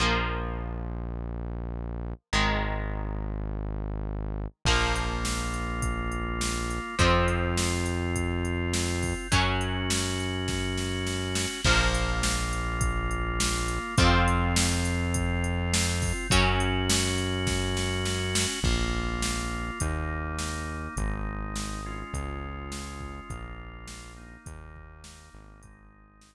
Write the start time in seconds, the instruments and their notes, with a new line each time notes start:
0.00 synth bass 1 A#1, overdriven guitar F3 A#3
2.33 synth bass 1 G#1, overdriven guitar D#3 G#3
4.65 synth bass 1 A#1, overdriven guitar F3 A#3, drawbar organ A#3 F4, kick, crash
4.96 closed hi-hat
5.25 snare
5.54 closed hi-hat
5.82 kick, closed hi-hat
6.12 closed hi-hat
6.41 snare
6.71 closed hi-hat
6.99 synth bass 1 F2, overdriven guitar F3 C4, drawbar organ C4 F4, kick, closed hi-hat
7.28 closed hi-hat
7.57 snare
7.86 closed hi-hat
8.16 kick, closed hi-hat
8.45 closed hi-hat
8.74 snare
9.02 kick, open hi-hat
9.32 synth bass 1 F#2, overdriven guitar F#3 C#4, drawbar organ C#4 F#4, kick, closed hi-hat
9.61 closed hi-hat
9.90 snare
10.20 closed hi-hat
10.48 kick, snare
10.78 snare
11.07 snare
11.35 snare
11.64 synth bass 1 A#1, overdriven guitar F3 A#3, drawbar organ A#3 F4, kick, crash
11.94 closed hi-hat
12.23 snare
12.53 closed hi-hat
12.81 kick, closed hi-hat
13.11 closed hi-hat
13.40 snare
13.68 closed hi-hat
13.98 synth bass 1 F2, overdriven guitar F3 C4, drawbar organ C4 F4, kick, closed hi-hat
14.28 closed hi-hat
14.56 snare
14.85 closed hi-hat
15.14 kick, closed hi-hat
15.44 closed hi-hat
15.74 snare
16.02 kick, open hi-hat
16.30 synth bass 1 F#2, overdriven guitar F#3 C#4, drawbar organ C#4 F#4, kick, closed hi-hat
16.60 closed hi-hat
16.90 snare
17.18 closed hi-hat
17.47 kick, snare
17.77 snare
18.05 snare
18.35 snare
18.63 synth bass 1 A#1, drawbar organ A#3 F4, kick, crash
19.22 snare
19.80 synth bass 1 D#2, drawbar organ A#3 D#4, kick, closed hi-hat
20.39 snare
20.97 synth bass 1 G#1, drawbar organ G#3 D#4, kick, closed hi-hat
21.56 snare
21.86 drawbar organ G#3 C#4 F4
22.13 synth bass 1 C#2, kick, closed hi-hat
22.72 snare
23.00 kick
23.29 synth bass 1 A#1, drawbar organ A#3 F4, kick, closed hi-hat
23.87 snare
24.17 drawbar organ A#3 D#4
24.46 synth bass 1 D#2, kick, closed hi-hat
24.76 kick
25.04 snare
25.34 synth bass 1 G#1
25.62 drawbar organ G#3 D#4, kick, closed hi-hat
26.21 snare